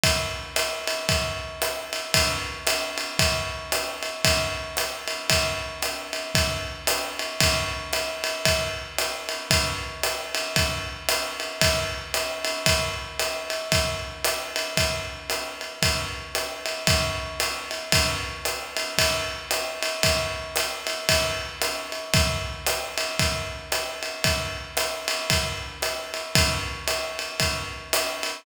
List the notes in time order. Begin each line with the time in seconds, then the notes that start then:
0.04 kick, ride
0.56 hi-hat pedal, ride
0.88 ride
1.09 kick, ride
1.62 hi-hat pedal, ride
1.93 ride
2.14 kick, ride
2.67 hi-hat pedal, ride
2.98 ride
3.19 kick, ride
3.72 hi-hat pedal, ride
4.03 ride
4.24 kick, ride
4.77 hi-hat pedal, ride
5.08 ride
5.30 kick, ride
5.82 hi-hat pedal, ride
6.13 ride
6.35 kick, ride
6.87 hi-hat pedal, ride
7.19 ride
7.40 kick, ride
7.93 hi-hat pedal, ride
8.24 ride
8.45 kick, ride
8.98 hi-hat pedal, ride
9.29 ride
9.51 kick, ride
10.03 hi-hat pedal, ride
10.35 ride
10.56 kick, ride
11.09 hi-hat pedal, ride
11.40 ride
11.61 kick, ride
12.14 hi-hat pedal, ride
12.45 ride
12.66 kick, ride
13.19 hi-hat pedal, ride
13.50 ride
13.72 kick, ride
14.24 hi-hat pedal, ride
14.56 ride
14.77 kick, ride
15.30 hi-hat pedal, ride
15.61 ride
15.82 kick, ride
16.35 hi-hat pedal, ride
16.66 ride
16.87 kick, ride
17.40 hi-hat pedal, ride
17.71 ride
17.92 kick, ride
18.45 hi-hat pedal, ride
18.77 ride
18.98 kick, ride
19.51 hi-hat pedal, ride
19.83 ride
20.03 kick, ride
20.56 hi-hat pedal, ride
20.87 ride
21.09 kick, ride
21.62 hi-hat pedal, ride
21.92 ride
22.14 kick, ride
22.66 hi-hat pedal, ride
22.98 ride
23.19 kick, ride
23.72 hi-hat pedal, ride
24.03 ride
24.24 kick, ride
24.77 hi-hat pedal, ride
25.08 ride
25.30 kick, ride
25.82 hi-hat pedal, ride
26.14 ride
26.35 kick, ride
26.88 hi-hat pedal, ride
27.19 ride
27.40 kick, ride
27.93 hi-hat pedal, ride
28.23 ride